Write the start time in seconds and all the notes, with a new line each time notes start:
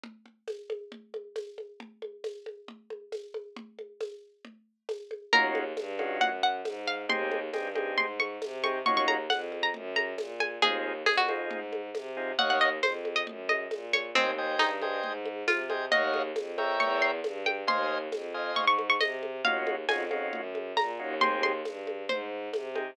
0.03 low conga
0.26 low conga
0.48 tambourine, high conga
0.70 high conga
0.92 low conga
1.14 high conga
1.36 tambourine, high conga
1.58 high conga
1.80 low conga
2.02 high conga
2.24 tambourine, high conga
2.46 high conga
2.68 low conga
2.90 high conga
3.12 tambourine, high conga
3.34 high conga
3.56 low conga
3.79 high conga
4.00 tambourine, high conga
4.45 low conga
4.89 tambourine, high conga
5.11 high conga
5.33 D#2 C#4 D#4 F4 F#4 A#4, low conga
5.55 high conga
5.77 G2, tambourine, high conga
5.99 C#4 D#4 F4 F#4, high conga
6.21 F#2 F#5, low conga
6.43 F#5
6.65 G#2, tambourine, high conga
6.87 F5
7.09 D#2 C4 D#4 G4 G#4 C6, low conga
7.31 high conga
7.53 G2 C4 D#4 G4 G#4, tambourine, high conga
7.75 C4 D#4 G4 G#4, high conga
7.98 G#2 C6, low conga
8.20 C#6, high conga
8.42 C3, tambourine, high conga
8.63 C4 D#4 G4 G#4 C#6, high conga
8.86 D#2 C#4 D#4 F4 F#4 C#6, low conga
8.97 C#6
9.08 A#5, high conga
9.30 F2 F#5, tambourine, high conga
9.52 high conga
9.63 A#5
9.74 F#2, low conga
9.96 A#5, high conga
10.18 A#2, tambourine, high conga
10.40 G#5, high conga
10.62 D#2 C4 D#4 F4 G#4, low conga
11.06 F2 G#4, tambourine, high conga
11.17 F#4
11.28 C4 D#4 F4 G#4, high conga
11.50 G#2, low conga
11.73 high conga
11.95 C3, tambourine, high conga
12.17 C4 D#4 F4 G#4
12.38 D#2 C#5 D#5 F5 F#5, low conga
12.50 F#5
12.61 D#5
12.83 F2 C5, tambourine, high conga
13.05 high conga
13.16 D#5
13.27 F#2, low conga
13.49 D#5, high conga
13.71 A#2, tambourine, high conga
13.93 C#5, high conga
14.15 D#2 C4 C5 D#5 G5 G#5, low conga
14.38 C5 D#5 G5 G#5
14.59 G2 D#4, tambourine, high conga
14.82 C5 D#5 G5 G#5, high conga
15.03 G#2, low conga
15.25 high conga
15.48 C3 F4, tambourine, high conga
15.70 C5 D#5 G5 G#5, high conga
15.91 D#2 C#5 D#5 F5 F#5, low conga
16.14 high conga
16.36 F2, tambourine, high conga
16.58 A#4 C#5 E5 G5, high conga
16.80 E2 C#6, low conga
17.02 C6
17.24 G2, tambourine, high conga
17.46 G5, high conga
17.67 D#2 C5 D#5 F5 G#5 C6, low conga
18.12 F2, tambourine, high conga
18.34 C5 D#5 F5 G#5
18.56 G#2 C#6, low conga
18.67 C#6
18.79 high conga
18.90 C#6
19.01 C3 D#5, tambourine, high conga
19.23 high conga
19.45 D#2 C#4 D#4 F4 F#4 F5, low conga
19.67 high conga
19.89 F2 C#4 D#4 F4 F#4 G#5, tambourine, high conga
20.10 C#4 D#4 F4 F#4, high conga
20.33 F#2, low conga
20.55 high conga
20.77 A#2 A#5, tambourine, high conga
20.99 D#2 C#4 D#4 F4 F#4
21.21 C4 D#4 G4 G#4 C6, low conga
21.43 C6, high conga
21.65 G2, tambourine, high conga
21.87 high conga
22.09 G#2 C5, low conga
22.53 C3, tambourine, high conga
22.75 C4 D#4 G4 G#4, high conga